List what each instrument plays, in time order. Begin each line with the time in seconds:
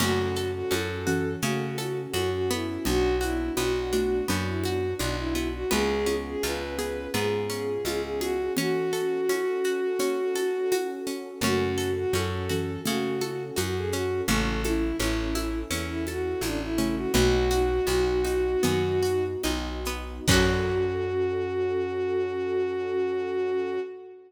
0.00 electric bass (finger) F#2, xylophone C#3 A3, pizzicato strings C#4, pad 2 (warm) C#4 F#4 A4, violin F#4, crash, low conga, shaker
0.36 pizzicato strings A4, shaker
0.54 violin F#4
0.70 electric bass (finger) F#2, pizzicato strings C#4, violin A4, high conga, shaker
1.07 xylophone E3 C#4, pizzicato strings F#4, shaker
1.41 electric bass (finger) C#3, xylophone C#3 A3, pizzicato strings C#4, violin F#4, low conga, shaker
1.78 pizzicato strings A4, high conga, shaker
2.13 electric bass (finger) F#2, violin F#4, pizzicato strings F#4, high conga, shaker
2.33 violin F#4
2.50 pizzicato strings B3, violin E4, shaker
2.85 electric bass (finger) B1, xylophone F#3 D4, pad 2 (warm) B3 D4 F#4, violin F#4, low conga, shaker
3.21 violin E4, pizzicato strings F#4, high conga, shaker
3.57 electric bass (finger) B1, pizzicato strings B3, violin F#4, high conga, shaker
3.93 xylophone A3 F#4, pizzicato strings D4, high conga, shaker
4.28 electric bass (finger) F#2, xylophone F#3 D4, pizzicato strings B3, low conga, shaker
4.47 violin E4
4.63 violin F#4, pizzicato strings F#4, high conga, shaker
4.99 electric bass (finger) B1, pizzicato strings D4, violin D4, high conga, shaker
5.18 violin E4
5.35 pizzicato strings B3, high conga, shaker
5.53 violin F#4
5.71 electric bass (finger) C#2, xylophone G#3 F4, pizzicato strings B3, pad 2 (warm) B3 C#4 F4 G#4, violin G#4, low conga, shaker
6.06 pizzicato strings C#4, high conga, shaker
6.26 violin G#4
6.43 electric bass (finger) C#2, pizzicato strings F4, violin B4, high conga, shaker
6.78 xylophone B3 G#4, pizzicato strings G#4, shaker
7.14 electric bass (finger) G#2, pizzicato strings B3, xylophone B3 G#4, violin G#4, low conga, shaker
7.50 pizzicato strings C#4, shaker
7.85 electric bass (finger) C#2, pizzicato strings F4, violin G#4, high conga, shaker
8.03 violin G#4
8.20 violin F#4, pizzicato strings G#4, high conga, shaker
8.57 xylophone E3 C#4, pad 2 (warm) C#4 F#4 A4, pizzicato strings C#4, violin F#4, low conga, shaker
8.93 pizzicato strings A4, shaker
9.29 pizzicato strings C#4, high conga, shaker
9.64 pizzicato strings F#4, shaker
9.99 pizzicato strings C#4, low conga, shaker
10.35 pizzicato strings A4, high conga, shaker
10.71 pizzicato strings F#4, high conga, shaker
11.07 pizzicato strings C#4, shaker
11.41 electric bass (finger) F#2, xylophone C#3 A3, pad 2 (warm) C#4 F#4 A4, pizzicato strings C#4, violin F#4, low conga, shaker
11.78 pizzicato strings A4, shaker
11.97 violin F#4
12.13 electric bass (finger) F#2, pizzicato strings C#4, violin A4, high conga, shaker
12.49 xylophone E3 C#4, pizzicato strings F#4, shaker
12.85 xylophone C#3 A3, electric bass (finger) C#3, pizzicato strings C#4, violin F#4, low conga, shaker
13.21 pizzicato strings A4, high conga, shaker
13.56 electric bass (finger) F#2, pizzicato strings F#4, violin F#4, high conga, shaker
13.76 violin G#4
13.91 pizzicato strings C#4, violin F#4, shaker
14.28 electric bass (finger) A1, xylophone C#3 A3, pizzicato strings C#4, pad 2 (warm) C#4 E4 A4, violin A4, low conga, shaker
14.63 violin E4, pizzicato strings A4, high conga, shaker
14.99 electric bass (finger) A1, pizzicato strings C#4, violin E4, high conga, shaker
15.35 pizzicato strings E4, high conga, shaker
15.71 electric bass (finger) E2, pizzicato strings C#4, low conga, shaker
15.88 violin E4
16.07 violin F#4, pizzicato strings A4, high conga, shaker
16.41 electric bass (finger) A1, violin D4, pizzicato strings E4, high conga, shaker
16.61 violin E4
16.78 xylophone C#3 A3, pizzicato strings C#4, shaker
16.95 violin F#4
17.13 electric bass (finger) B1, xylophone A3 F#4, pizzicato strings B3, pad 2 (warm) B3 D#4 F#4, violin F#4, low conga, shaker
17.50 pizzicato strings F#4, high conga, shaker
17.87 electric bass (finger) B1, pizzicato strings B3, high conga, shaker
18.24 pizzicato strings D#4, high conga, shaker
18.63 electric bass (finger) F#2, xylophone D#3 B3, pizzicato strings B3, low conga, shaker
19.03 pizzicato strings F#4, shaker
19.43 electric bass (finger) B1, pizzicato strings D#4, high conga, shaker
19.85 pizzicato strings B3, shaker
20.28 electric bass (finger) F#2, xylophone F#3, pad 2 (warm) C#4 F#4 A4, pizzicato strings C#4 F#4, violin F#4, kick, crash
20.34 pizzicato strings A4